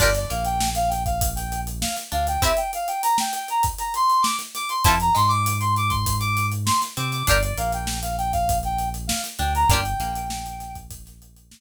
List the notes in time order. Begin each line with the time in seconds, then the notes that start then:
0.00 G1 D4 F4 G4 A#4 D5, kick, crash
0.15 D5, closed hi-hat
0.30 A#1 A#3 F5, closed hi-hat
0.45 G5, closed hi-hat
0.60 snare
0.75 F5, closed hi-hat
0.89 G5, snare, closed hi-hat
1.05 F5, kick, closed hi-hat
1.21 kick, closed hi-hat
1.36 G5, closed hi-hat
1.52 closed hi-hat
1.67 closed hi-hat
1.81 F5, snare
1.97 snare, closed hi-hat
2.12 D2 D4 F5, closed hi-hat
2.27 G5, closed hi-hat
2.42 C4 E4 G4 E5, kick, closed hi-hat
2.57 G5, closed hi-hat
2.73 F5, closed hi-hat
2.88 G5, closed hi-hat
3.03 A#5, closed hi-hat
3.18 G5, snare
3.33 G5, closed hi-hat
3.48 A#5, closed hi-hat
3.63 kick, closed hi-hat
3.78 A#5, closed hi-hat
3.94 C6, closed hi-hat
4.10 closed hi-hat
4.22 D6, snare
4.39 snare, closed hi-hat
4.55 D6, snare, closed hi-hat
4.69 C6, closed hi-hat
4.84 F2 C4 E4 F4 A5, kick, closed hi-hat
4.88 A4
5.00 A#5, closed hi-hat
5.15 G#2 G#3 C6, closed hi-hat
5.28 D6, closed hi-hat
5.46 closed hi-hat
5.60 C6, closed hi-hat
5.76 D6, closed hi-hat
5.89 C6, kick, closed hi-hat
6.06 kick, closed hi-hat
6.20 D6, closed hi-hat
6.37 closed hi-hat
6.52 closed hi-hat
6.66 C6, snare
6.82 snare, closed hi-hat
6.97 C3 C4 D6, closed hi-hat
7.12 D6, snare, closed hi-hat
7.27 G1 D4 F4 G4 A#4 D5, kick, closed hi-hat
7.42 D5, closed hi-hat
7.58 A#1 A#3 F5, closed hi-hat
7.72 G5, closed hi-hat
7.87 snare
8.02 F5, closed hi-hat
8.18 G5, closed hi-hat
8.33 F5, kick, closed hi-hat
8.49 kick, closed hi-hat
8.63 G5, closed hi-hat
8.79 closed hi-hat
8.94 closed hi-hat
9.07 F5, snare
9.24 snare, closed hi-hat
9.39 D2 D4 G5, snare, closed hi-hat
9.55 A#5, closed hi-hat
9.68 G1 A#3 D4 G5, kick, closed hi-hat
9.72 F4 G4
9.85 closed hi-hat
10.00 A#1 A#3, closed hi-hat
10.15 closed hi-hat
10.30 snare
10.46 closed hi-hat
10.60 snare, closed hi-hat
10.75 kick, closed hi-hat
10.91 kick, closed hi-hat
11.06 snare, closed hi-hat
11.22 closed hi-hat
11.36 closed hi-hat
11.51 snare